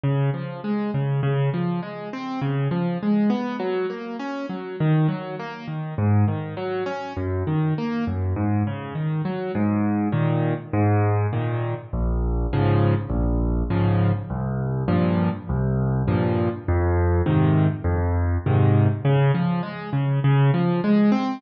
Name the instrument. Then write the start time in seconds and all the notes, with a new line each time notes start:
acoustic grand piano
0.03 C#3
0.34 F3
0.64 G#3
0.94 C#3
1.23 C#3
1.54 F3
1.82 G#3
2.13 C4
2.41 C#3
2.71 F3
3.02 G#3
3.30 B3
3.59 F#3
3.90 A#3
4.19 C#4
4.49 F#3
4.80 D#3
5.08 F#3
5.39 A#3
5.68 D#3
5.98 G#2
6.28 D#3
6.57 F#3
6.86 C#4
7.17 F#2
7.47 D#3
7.78 A#3
8.07 F#2
8.36 G#2
8.67 C#3
8.95 D#3
9.25 F#3
9.55 G#2
10.12 A#2 D#3
10.73 G#2
11.33 A#2 D#3
11.93 A#1
12.53 G#2 C#3 F3
13.10 A#1
13.70 G#2 C#3 F3
14.30 C2
14.88 G2 A#2 F3
15.49 C2
16.08 G2 A#2 F3
16.68 F2
17.26 G#2 C3 D#3
17.84 F2
18.46 G#2 C3 D#3
19.05 C#3
19.34 F3
19.63 G#3
19.93 C#3
20.24 C#3
20.54 F3
20.84 G#3
21.12 C4